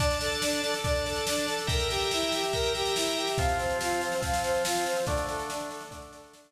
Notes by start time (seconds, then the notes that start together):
0.00 D4 D5 A5, kick, snare
0.10 snare
0.21 A4, snare
0.32 snare
0.42 D4, snare
0.53 snare
0.64 A4, snare
0.74 snare
0.84 D4 D5 A5, kick, snare
0.95 snare
1.06 A4, snare
1.16 snare
1.27 D4, snare
1.38 snare
1.48 A4, snare
1.59 snare
1.67 A#4 E5 G5 A#5, kick, snare
1.80 snare
1.90 G4, snare
2.01 snare
2.11 E4, snare
2.22 snare
2.32 G4, snare
2.43 snare
2.53 A#4 E5 G5 A#5, kick, snare
2.64 snare
2.74 G4, snare
2.85 snare
2.96 E4, snare
3.06 snare
3.17 G4, snare
3.27 snare
3.38 F3 C4 F4 F5, kick, snare
3.49 snare
3.59 C5, snare
3.70 snare
3.81 F4, snare
3.90 snare
4.01 C5, snare
4.12 snare
4.21 F3 C4 F4 F5, kick, snare
4.33 snare
4.44 C5, snare
4.54 snare
4.65 F4, snare
4.75 snare
4.86 C5, snare
4.96 snare
5.07 D3 A3 D4 D5, kick, snare
5.17 snare
5.27 A4, snare
5.39 snare
5.50 D4, snare
5.60 snare
5.70 A4, snare
5.81 snare
5.91 D3 A3 D4 D5, kick, snare
6.02 snare
6.13 A4, snare
6.24 snare
6.33 D4, snare
6.44 snare